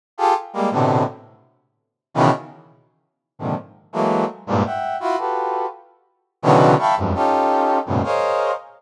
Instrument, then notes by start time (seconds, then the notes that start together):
brass section
0.18 F4 G4 G#4 A4
0.53 G3 G#3 A#3
0.71 A2 B2 C3 D3
2.14 B2 C#3 D#3 E3
3.39 G#2 A#2 C3 D3 D#3 F3
3.93 E3 F#3 G#3 A3 A#3
4.47 G2 G#2 A#2
4.65 E5 F#5 G5
5.00 E4 F4 F#4
5.18 F4 F#4 G4 A4 B4
6.42 B2 C#3 D3 D#3 E3 F#3
6.79 E5 F5 G5 A5 B5 C#6
6.97 F2 F#2 G2 G#2
7.14 C#4 D#4 F4 G4 A4
7.86 F#2 G#2 A2 A#2 B2 C#3
8.03 G#4 A#4 C5 C#5 D#5 F5